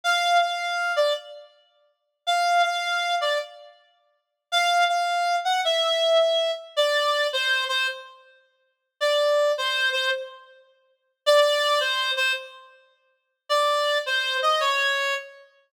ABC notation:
X:1
M:4/4
L:1/8
Q:"Swing" 1/4=107
K:F
V:1 name="Clarinet"
f f2 d z4 | f f2 d z4 | f f2 ^f e3 z | d2 c c z4 |
d2 c c z4 | d2 c c z4 | d2 c ^d _d2 z2 |]